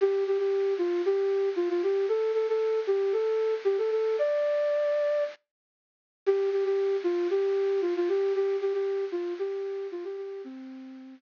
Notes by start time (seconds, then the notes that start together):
0.01 G4
0.27 G4
0.38 G4
0.78 F4
1.06 G4
1.56 F4
1.69 F4
1.83 G4
2.09 A4
2.34 A4
2.48 A4
2.87 G4
3.12 A4
3.65 G4
3.78 A4
3.91 A4
4.19 D5
6.26 G4
6.52 G4
6.65 G4
7.04 F4
7.30 G4
7.81 F4
7.96 F4
8.08 G4
8.35 G4
8.61 G4
8.73 G4
9.12 F4
9.39 G4
9.92 F4
10.04 G4
10.17 G4
10.44 C4